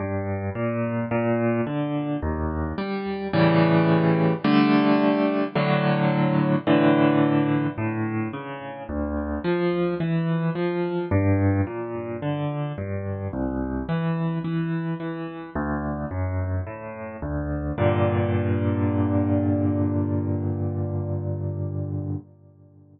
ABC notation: X:1
M:4/4
L:1/8
Q:1/4=54
K:Gm
V:1 name="Acoustic Grand Piano"
G,, B,, B,, D, E,, G, [A,,^C,=E,G,]2 | [D,G,A,]2 [A,,D,^F,]2 [A,,D,=E,]2 A,, ^C, | D,, F, =E, F, G,, B,, D, G,, | C,, =E, E, E, D,, ^F,, A,, D,, |
[G,,B,,D,]8 |]